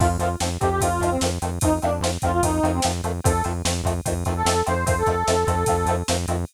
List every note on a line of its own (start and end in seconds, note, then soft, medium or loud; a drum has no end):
0.00 0.17 F2 loud
0.00 0.08 D#3 medium
0.00 0.08 F3 medium
0.00 0.08 A3 medium
0.00 0.08 C4 medium
0.00 0.09 F4 loud
0.00 kick loud
0.00 crash medium
0.19 0.36 F2 medium
0.19 0.28 D#3 medium
0.19 0.28 F3 medium
0.19 0.28 A3 medium
0.19 0.28 C4 medium
0.19 0.29 F4 medium
0.19 ride medium
0.40 0.58 F2 medium
0.40 0.49 D#3 medium
0.40 0.49 F3 medium
0.40 0.49 A3 medium
0.40 0.49 C4 medium
0.40 snare loud
0.60 0.80 F2 medium
0.60 0.69 D#3 medium
0.60 0.69 F3 medium
0.60 0.69 A3 medium
0.60 0.69 C4 medium
0.60 0.70 G4 medium
0.60 kick medium
0.60 ride medium
0.70 0.80 G4 medium
0.81 0.99 F2 medium
0.81 0.89 D#3 medium
0.81 0.89 F3 medium
0.81 0.89 A3 medium
0.81 0.89 C4 medium
0.81 1.10 F4 medium
0.81 kick medium
0.81 ride loud
1.00 1.18 F2 medium
1.00 1.09 D#3 medium
1.00 1.09 F3 medium
1.00 1.09 A3 medium
1.00 1.09 C4 medium
1.00 kick medium
1.00 ride medium
1.11 1.20 C4 medium
1.21 1.39 F2 medium
1.21 1.30 D#3 medium
1.21 1.30 F3 medium
1.21 1.30 A3 medium
1.21 1.30 C4 medium
1.21 snare loud
1.42 1.59 F2 medium
1.42 1.50 D#3 medium
1.42 1.50 F3 medium
1.42 1.50 A3 medium
1.42 1.50 C4 medium
1.42 ride medium
1.61 1.80 F2 medium
1.61 1.70 D#3 medium
1.61 1.70 F3 medium
1.61 1.70 A3 medium
1.61 1.70 C4 medium
1.61 1.73 D#4 loud
1.61 kick loud
1.61 ride loud
1.82 2.00 F2 medium
1.82 1.90 D#3 medium
1.82 1.90 F3 medium
1.82 1.90 A3 medium
1.82 1.90 C4 medium
1.82 1.93 D4 medium
1.82 ride medium
2.01 2.18 F2 medium
2.01 2.11 F3 medium
2.01 2.11 A3 medium
2.01 2.11 C4 medium
2.01 snare loud
2.05 2.11 D#3 medium
2.22 2.41 F2 medium
2.22 2.31 D#3 medium
2.22 2.31 F3 medium
2.22 2.31 A3 medium
2.22 2.31 C4 medium
2.22 2.32 F4 medium
2.22 kick medium
2.22 ride medium
2.32 2.42 F4 medium
2.43 2.60 F2 medium
2.43 2.51 D#3 medium
2.43 2.51 F3 medium
2.43 2.51 A3 medium
2.43 2.51 C4 medium
2.43 2.71 D#4 medium
2.43 kick loud
2.43 ride loud
2.63 2.80 F2 loud
2.63 2.72 D#3 medium
2.63 2.72 F3 medium
2.63 2.72 A3 medium
2.63 2.72 C4 medium
2.63 ride medium
2.74 2.84 C4 medium
2.82 3.02 F2 medium
2.82 2.92 D#3 medium
2.82 2.92 F3 medium
2.82 2.92 A3 medium
2.82 2.92 C4 medium
2.82 snare loud
3.03 3.21 F2 medium
3.03 3.12 D#3 medium
3.03 3.12 F3 medium
3.03 3.12 A3 medium
3.03 3.12 C4 medium
3.03 ride medium
3.24 3.42 F2 loud
3.24 3.32 D#3 medium
3.24 3.32 F3 medium
3.24 3.32 A3 medium
3.24 3.32 C4 medium
3.24 3.42 A4 loud
3.24 kick loud
3.24 ride loud
3.44 3.63 F2 medium
3.44 3.53 D#3 medium
3.44 3.53 F3 medium
3.44 3.53 A3 medium
3.44 3.53 C4 medium
3.44 ride medium
3.65 3.82 F2 medium
3.65 3.73 D#3 medium
3.65 3.73 F3 medium
3.65 3.73 A3 medium
3.65 3.73 C4 medium
3.65 snare loud
3.84 4.01 F2 medium
3.84 3.93 D#3 medium
3.84 3.93 F3 medium
3.84 3.93 A3 medium
3.84 3.93 C4 medium
3.84 kick medium
3.84 ride medium
4.05 4.25 F2 medium
4.05 4.14 D#3 medium
4.05 4.14 F3 medium
4.05 4.14 A3 medium
4.05 4.14 C4 medium
4.05 kick loud
4.05 ride loud
4.25 4.43 F2 medium
4.25 4.34 D#3 medium
4.25 4.34 F3 medium
4.25 4.34 A3 medium
4.25 4.34 C4 medium
4.25 kick medium
4.25 ride medium
4.36 4.61 A4 loud
4.45 4.63 F2 medium
4.45 4.54 D#3 medium
4.45 4.54 F3 medium
4.45 4.54 A3 medium
4.45 4.54 C4 medium
4.45 snare loud
4.66 4.85 F2 medium
4.66 4.74 D#3 medium
4.66 4.74 F3 medium
4.66 4.74 A3 medium
4.66 4.74 C4 medium
4.66 4.84 C5 medium
4.66 ride medium
4.86 5.03 F2 medium
4.86 4.95 D#3 medium
4.86 4.95 F3 medium
4.86 4.95 A3 medium
4.86 4.95 C4 medium
4.86 4.95 C5 loud
4.86 kick loud
4.86 ride loud
4.98 5.93 A4 medium
5.06 5.24 F2 medium
5.06 5.15 D#3 medium
5.06 5.15 F3 medium
5.06 5.15 A3 medium
5.06 5.15 C4 medium
5.06 kick medium
5.06 ride medium
5.27 5.45 F2 medium
5.27 5.35 D#3 medium
5.27 5.35 F3 medium
5.27 5.35 A3 medium
5.27 5.35 C4 medium
5.27 snare loud
5.47 5.64 F2 loud
5.47 5.55 D#3 medium
5.47 5.55 F3 medium
5.47 5.55 A3 medium
5.47 5.55 C4 medium
5.47 kick medium
5.47 ride medium
5.66 5.85 F2 loud
5.66 5.76 D#3 medium
5.66 5.76 F3 medium
5.66 5.76 A3 medium
5.66 5.76 C4 medium
5.66 kick loud
5.66 ride loud
5.86 6.03 F2 loud
5.86 5.96 F3 medium
5.86 5.96 A3 medium
5.86 5.96 C4 medium
5.86 ride medium
5.90 5.96 D#3 medium
6.08 6.26 F2 medium
6.08 6.16 D#3 medium
6.08 6.16 F3 medium
6.08 6.16 A3 medium
6.08 6.16 C4 medium
6.08 snare loud
6.28 6.45 F2 loud
6.28 6.36 D#3 medium
6.28 6.36 F3 medium
6.28 6.36 A3 medium
6.28 6.36 C4 medium
6.28 ride medium